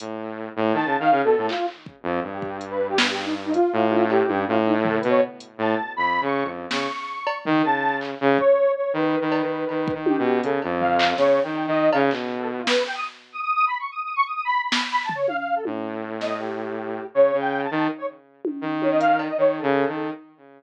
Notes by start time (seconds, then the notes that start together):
0.00 A2, closed hi-hat
0.56 A2
0.73 D#3 A5
0.85 C#3
0.99 D#3 F5
1.11 C#3
1.24 B2 A4
1.38 A2
1.49 F4, clap
1.68 clap
1.86 kick
2.03 F2
2.23 G2
2.33 G4
2.42 kick
2.61 closed hi-hat
2.70 B4
2.89 G4
2.98 B4, snare
3.11 G4
3.23 D#4
3.45 D#4
3.54 F4, closed hi-hat
3.73 A2
3.91 high tom
4.10 G4, cowbell
4.28 G2, high tom
4.48 A2 F4
4.66 D#4
4.84 A4, floor tom
4.97 B4
5.03 B2, closed hi-hat
5.09 C#5
5.40 closed hi-hat
5.58 A2 A5
5.96 F2 B5
6.21 C#3 C#6
6.44 F2
6.70 C#3 C#6, snare
7.27 cowbell
7.45 D#3, floor tom
7.64 C#3 A5
8.01 clap
8.21 C#3
8.38 C#5, kick
8.76 C#5
8.93 D#3 B4
9.21 D#3
9.32 cowbell
9.42 D#3
9.69 D#3, cowbell
9.88 kick
9.94 D#3
10.06 G4, high tom
10.19 B2
10.43 C#3 A4, closed hi-hat
10.62 F2, cowbell
10.80 F5, floor tom
10.99 clap
11.17 C#3 C#5, snare
11.43 D#3 G5
11.55 cowbell
11.67 D#3 D#5
11.92 C#3 F5, cowbell
12.11 B2, clap
12.39 A4
12.58 F4
12.67 B4, snare
12.86 G5
12.95 D#6
13.33 D#6
13.42 D#6
13.54 D#6
13.67 B5
13.79 C#6
13.91 D#6
14.04 D#6
14.16 C#6
14.26 D#6
14.35 D#6
14.45 B5
14.62 B5
14.72 snare
14.91 B5
15.04 A5
15.09 floor tom
15.15 C#5
15.28 F5, high tom
15.38 F5
15.56 A4
15.65 A2, high tom
16.21 D#5, snare
16.39 G4
17.14 C#3 C#5
17.33 C#3
17.39 G5
17.64 A5
17.71 D#3
17.98 C#5
18.45 high tom
18.61 D#3
18.82 C#5, high tom
18.91 D#5
19.00 F5, closed hi-hat
19.19 cowbell
19.29 D#5
19.38 D#3 C#5
19.57 A4
19.63 C#3
19.88 D#3